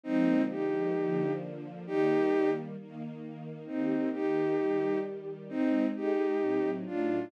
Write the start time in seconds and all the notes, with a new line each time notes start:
0.04 D3 F3 G#3 A#3 C4 D#4
0.50 D#4 G4
0.95 D3 F3 A#3 D4
1.86 D#3 G3 A#3 D#4 G4
2.78 D#3 A#3 D#4
3.66 D#3 A#3 C4 D#4 G4
4.13 D#4 G4
4.59 D#3 G3 G4
5.49 G#3 C4 D#4
5.93 G#3 D#4 G4 G#4
6.40 A2 F#3 C4 D#4
6.85 A2 F#3 A3 D4 D#4 F4